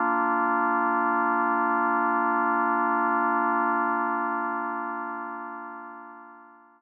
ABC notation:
X:1
M:4/4
L:1/8
Q:1/4=66
K:Bb
V:1 name="Drawbar Organ"
[B,DF]8- | [B,DF]8 |]